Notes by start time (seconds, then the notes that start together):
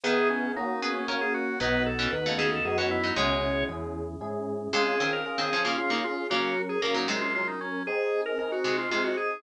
0.03 D#3 B3 E4 G#4
0.30 C#4
0.56 A#3 C#4 D#4 F#4
0.82 B3 C#4 G#4
0.95 C#4
1.08 A#3 C#4 F#4 A#4
1.21 G#4
1.34 F#4
1.60 B1 F#3 B3 D#4 F#4 B4
1.86 A4
1.99 E3 C#4
2.12 D#2 B3 D#4 F#4 B4
2.26 C#3 A3
2.38 C#3 A3 G#4
2.52 A4
2.65 F#2 B3 D#4 F#4 G#4
2.78 E3 C#4 F#4
2.91 E4
3.03 F#3 D#4
3.16 C#2 B2 G#3 C#4 E4 G#4 C#5
3.69 E2 C#4 E4 G#4
4.21 G#2 C#4 E4 G#4
4.73 C3 G#3 C#4 F4 G#4
5.00 D#3 C4
5.13 A#4
5.26 C#4 F4 G#4 A#4
5.38 D#3 C4 G#4
5.53 F3 C#4
5.65 C#3 A#3 F4
5.78 C#4 F4 G#4
5.90 C#3 A#3 D#4
6.04 F4
6.30 C#3 F#3 A#3 C#4 F#4 A#4
6.69 G#4
6.82 C#3 F#3 A#3 C#4 A#4
6.94 A#2 F#3 D#4
7.08 C3 G#3
7.21 F4
7.34 F#3 C#4 F4 A#4
7.47 D#4
7.61 C#4
7.87 C4 D#4 G#4
8.26 A#4
8.38 C4 D#4 G#4 A#4
8.52 F#4
8.64 C3 G#3
8.78 F4
8.91 C3 G#3 C4 D#4 F4 G#4
9.04 F#4
9.17 G#4